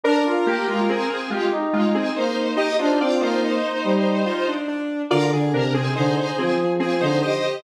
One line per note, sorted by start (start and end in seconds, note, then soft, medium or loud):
0.04 0.24 D4 medium
0.04 0.24 A#4 medium
0.04 1.15 A#4 loud
0.26 0.46 F4 medium
0.46 0.67 A#3 medium
0.46 0.67 G4 medium
0.67 0.87 G#3 medium
0.67 0.87 F4 medium
0.89 1.09 C4 medium
0.89 1.09 G#4 medium
1.10 1.30 C4 medium
1.10 1.30 G#4 medium
1.30 1.50 G#3 medium
1.30 1.50 F4 medium
1.30 1.52 G4 medium
1.51 2.06 D#4 medium
1.73 1.93 G#3 medium
1.73 1.93 F4 medium
1.95 2.15 C4 medium
1.95 2.15 G#4 medium
2.16 2.51 A#3 medium
2.16 2.56 D#4 medium
2.16 2.56 C5 medium
2.57 2.77 D#4 loud
2.57 2.77 D#4 medium
2.57 2.77 G4 medium
2.57 2.77 D#5 medium
2.79 2.99 D4 medium
2.79 2.99 D#4 medium
2.79 2.99 F4 medium
2.79 2.99 C5 medium
3.00 3.20 C4 medium
3.00 3.21 F4 medium
3.00 3.21 D5 medium
3.20 3.57 A#3 medium
3.20 4.54 D#4 medium
3.20 3.41 F4 medium
3.20 4.54 C5 medium
3.44 4.24 D#4 medium
3.84 4.24 G3 medium
4.26 4.46 F4 medium
4.48 4.68 D4 medium
4.68 5.02 D4 medium
5.11 5.31 D3 medium
5.11 5.31 F4 medium
5.11 5.31 A#4 loud
5.11 5.31 D5 medium
5.31 5.51 D3 medium
5.31 5.53 G#4 medium
5.52 5.89 C3 medium
5.52 5.74 D4 medium
5.52 5.74 A#4 medium
5.74 5.94 C4 medium
5.74 5.94 G#4 medium
5.74 5.95 G#4 medium
5.95 6.17 D3 medium
5.95 6.15 D#4 medium
5.95 6.74 G#4 medium
5.95 6.15 C5 medium
6.17 6.37 D#4 medium
6.17 6.37 C5 medium
6.38 6.58 F3 medium
6.38 6.58 C4 medium
6.38 6.58 G#4 medium
6.58 6.78 F3 medium
6.80 7.01 F3 medium
6.80 7.00 C4 medium
6.80 7.00 G#4 medium
6.80 7.02 G#4 medium
7.00 7.21 D3 medium
7.00 7.21 D#4 medium
7.00 7.20 C5 medium
7.00 7.21 C5 medium
7.22 7.61 G4 medium
7.22 7.57 C5 medium
7.22 7.61 D#5 medium